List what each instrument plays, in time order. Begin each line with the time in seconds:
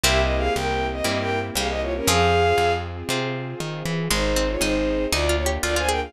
0.03 electric bass (finger) C2, string ensemble 1 A#3 C4 E4 G4, orchestral harp A#3 C4 E4 G4, harpsichord C4, violin G4 E5
0.21 violin D#5
0.37 violin G#4 F5
0.55 electric bass (finger) C2, violin A#4 G5
0.92 violin D#5
1.04 electric bass (finger) G2, orchestral harp A#3 C4 E4 G4, violin D#5
1.18 violin A#4 G5
1.55 electric bass (finger) C2, harpsichord G3, violin G#4 F5
1.69 violin D#5
1.81 violin F4 C#5
1.96 violin C#4 A#4
2.07 electric bass (finger) F2, harpsichord F3, string ensemble 1 C4 F4 G#4, orchestral harp C4 F4 G#4, violin G#4 F5
2.58 electric bass (finger) F2
3.09 electric bass (finger) C3, orchestral harp C4 F4 G#4
3.60 electric bass (finger) D#3
3.85 electric bass (finger) E3
4.10 electric bass (finger) G#1, harpsichord G#3, string ensemble 1 C4 D#4 G#4, violin D#4 C5
4.36 harpsichord C4
4.49 violin F4 C#5
4.61 electric bass (finger) G#1, harpsichord D#4, violin D#4 C5
5.12 electric bass (finger) D2, string ensemble 1 A#3 D4 F4, harpsichord D#4, violin F4 D5
5.29 harpsichord F4
5.37 violin C#5
5.46 harpsichord G4
5.63 electric bass (finger) D2, harpsichord F4, violin F4 D5
5.76 harpsichord F4, violin C5 G#5
5.88 harpsichord G#4, violin A#4 G5
6.03 violin G#4 F5